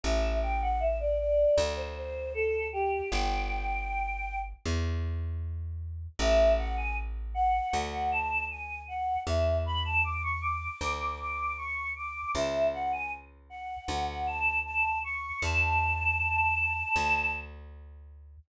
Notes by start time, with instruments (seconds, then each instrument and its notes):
0.04 electric bass (finger) A1, choir aahs E5
0.43 choir aahs G5
0.62 choir aahs F#5
0.80 choir aahs E5
1.00 choir aahs D5
1.19 choir aahs D5
1.58 electric bass (finger) D2
1.76 choir aahs C5
1.96 choir aahs C5
2.34 choir aahs A4
2.73 choir aahs G4
3.12 electric bass (finger) G1, choir aahs G5
4.65 electric bass (finger) E2
6.19 electric bass (finger) A1, choir aahs E5
6.58 choir aahs F#5
6.77 choir aahs G#5
7.34 choir aahs F#5
7.73 electric bass (finger) D2
7.92 choir aahs F#5
8.12 choir aahs A5
8.50 choir aahs G#5
8.88 choir aahs F#5
9.26 electric bass (finger) E2, choir aahs E5
9.66 choir aahs B5
9.85 choir aahs A5
10.04 choir aahs D6
10.23 choir aahs C#6
10.42 choir aahs D6
10.81 electric bass (finger) D2
11.00 choir aahs D6
11.20 choir aahs D6
11.58 choir aahs C#6
11.96 choir aahs D6
12.35 electric bass (finger) C#2, choir aahs E5
12.73 choir aahs F#5
12.92 choir aahs G#5
13.50 choir aahs F#5
13.88 electric bass (finger) D2
14.08 choir aahs F#5
14.27 choir aahs A5
14.65 choir aahs A5
15.04 choir aahs C#6
15.42 electric bass (finger) E2, choir aahs A5
16.96 electric bass (finger) D2